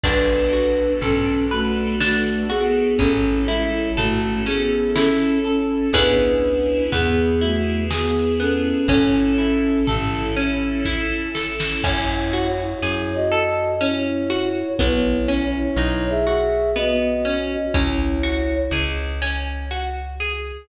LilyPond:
<<
  \new Staff \with { instrumentName = "Flute" } { \time 3/4 \key b \dorian \tempo 4 = 61 <d' b'>4 <cis' a'>8 <a fis'>8 <a fis'>8 <b gis'>8 | <cis' a'>8 <gis e'>8 <a fis'>8 <b gis'>8 <cis' a'>8 <cis' a'>8 | <d' b'>4 <b gis'>8 <a fis'>8 <b gis'>8 <cis' a'>8 | <cis' a'>4 r2 |
\key fis \dorian \tuplet 3/2 { <e' cis''>4 <e' cis''>4 <fis' dis''>4 } <e' cis''>4 | \tuplet 3/2 { <e' cis''>4 <e' cis''>4 <gis' e''>4 } <fis' dis''>4 | <e' cis''>4 r2 | }
  \new Staff \with { instrumentName = "Orchestral Harp" } { \time 3/4 \key b \dorian d'8 fis'8 a'8 b'8 d'8 fis'8 | cis'8 e'8 a'8 cis'8 e'8 a'8 | <b cis' e' gis'>4 b8 e'8 gis'8 b8 | cis'8 e'8 a'8 cis'8 e'8 a'8 |
\key fis \dorian cis'8 fis'8 gis'8 a'8 cis'8 fis'8 | b8 cis'8 dis'8 fis'8 b8 cis'8 | cis'8 fis'8 gis'8 cis'8 fis'8 gis'8 | }
  \new Staff \with { instrumentName = "Electric Bass (finger)" } { \clef bass \time 3/4 \key b \dorian b,,4 b,,2 | a,,4 a,,2 | cis,4 e,2 | a,,4 a,,2 |
\key fis \dorian fis,4 fis,2 | b,,4 b,,2 | cis,4 cis,2 | }
  \new Staff \with { instrumentName = "String Ensemble 1" } { \time 3/4 \key b \dorian <b d' fis' a'>2. | <cis' e' a'>2. | <b cis' e' gis'>4 <b e' gis'>2 | <cis' e' a'>2. |
\key fis \dorian r2. | r2. | r2. | }
  \new DrumStaff \with { instrumentName = "Drums" } \drummode { \time 3/4 <cymc bd>4 tomfh4 sn4 | <bd tomfh>4 tomfh4 sn4 | <bd tomfh>4 tomfh4 sn4 | <bd tomfh>4 tomfh4 <bd sn>8 sn16 sn16 |
<cymc bd>4 r4 r4 | bd4 r4 r4 | bd4 r4 r4 | }
>>